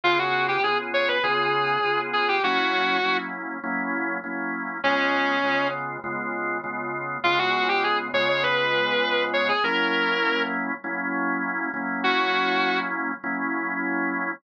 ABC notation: X:1
M:4/4
L:1/16
Q:1/4=100
K:Db
V:1 name="Distortion Guitar"
F G2 =G A z d _c A6 A G | G6 z10 | D6 z10 | F G2 =G A z d d _c6 d A |
B6 z10 | G6 z10 |]
V:2 name="Drawbar Organ"
[D,_CFA]4 [D,CFA]4 [D,CFA]4 [D,CFA]4 | [G,B,D_F]4 [G,B,DF]4 [G,B,DF]4 [G,B,DF]4 | [D,A,_CF]4 [D,A,CF]4 [D,A,CF]4 [D,A,CF]4 | [D,A,_CF]6 [D,A,CF]10 |
[G,B,D_F]8 [G,B,DF]6 [G,B,DF]2- | [G,B,D_F]8 [G,B,DF]8 |]